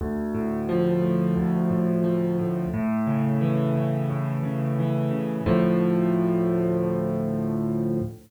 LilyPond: \new Staff { \clef bass \time 4/4 \key d \minor \tempo 4 = 88 d,8 a,8 f8 a,8 d,8 a,8 f8 a,8 | a,8 cis8 e8 cis8 a,8 cis8 e8 cis8 | <d, a, f>1 | }